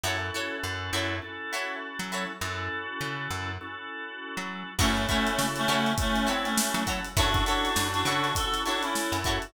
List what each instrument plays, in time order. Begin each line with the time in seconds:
0.04 electric bass (finger) F#2, drawbar organ C#4 E4 F#4 A4, acoustic guitar (steel) E4 F#4 A4 C#5
0.34 acoustic guitar (steel) E4 F#4 A4 C#5
0.63 electric bass (finger) F#2
0.93 electric bass (finger) F#2, acoustic guitar (steel) E4 F#4 A4 C#5
1.22 drawbar organ C#4 E4 F#4 A4
1.53 acoustic guitar (steel) E4 F#4 A4 C#5
1.99 electric bass (finger) F#3
2.12 acoustic guitar (steel) E4 F#4 A4 C#5
2.41 electric bass (finger) F#2, drawbar organ C#4 E4 F#4 A4
3.01 electric bass (finger) C#3
3.31 electric bass (finger) F#2
3.61 drawbar organ C#4 E4 F#4 A4
4.37 electric bass (finger) F#3
4.79 electric bass (finger) F#2, clarinet A3 C#4, drawbar organ C#4 E4 F#4 A4, acoustic guitar (steel) E4 F#4 A4 C#5, kick, crash
4.97 closed hi-hat
5.08 clarinet A3 C#4, acoustic guitar (steel) E4 F#4 A4 C#5, kick, closed hi-hat
5.27 closed hi-hat
5.38 electric bass (finger) C#3, snare
5.56 clarinet A3 C#4, snare, closed hi-hat
5.68 electric bass (finger) C#3, acoustic guitar (steel) E4 F#4 A4 C#5, closed hi-hat
5.86 closed hi-hat
5.98 clarinet A3 C#4, drawbar organ C#4 E4 F#4 A4, kick, closed hi-hat
6.16 closed hi-hat
6.27 clarinet C4, acoustic guitar (steel) E4 F#4 A4 C#5, closed hi-hat
6.45 clarinet A3 C#4, closed hi-hat
6.57 snare
6.74 electric bass (finger) F#3, closed hi-hat
6.87 acoustic guitar (steel) E4 F#4 A4 C#5, kick, snare, closed hi-hat
7.04 closed hi-hat
7.17 electric bass (finger) F#2, drawbar organ C#4 E4 F#4 A4, clarinet D4 F#4, acoustic guitar (steel) E4 F#4 A4 C#5, kick, closed hi-hat
7.34 kick, closed hi-hat
7.46 clarinet D4 F#4, acoustic guitar (steel) E4 F#4 A4 C#5, closed hi-hat
7.65 closed hi-hat
7.76 electric bass (finger) F#2, snare
7.93 clarinet D4 F#4, closed hi-hat
8.05 electric bass (finger) C#3, acoustic guitar (steel) E4 F#4 A4 C#5, snare, closed hi-hat
8.24 closed hi-hat
8.35 drawbar organ C#4 E4 F#4 A4, clarinet F#4 A4, kick, closed hi-hat
8.54 closed hi-hat
8.65 clarinet D4 F#4, acoustic guitar (steel) E4 F#4 A4 C#5, closed hi-hat
8.83 clarinet C#4 E4, closed hi-hat
8.95 snare
9.12 electric bass (finger) F#2, closed hi-hat
9.24 acoustic guitar (steel) E4 F#4 A4 C#5, kick, snare, closed hi-hat
9.42 closed hi-hat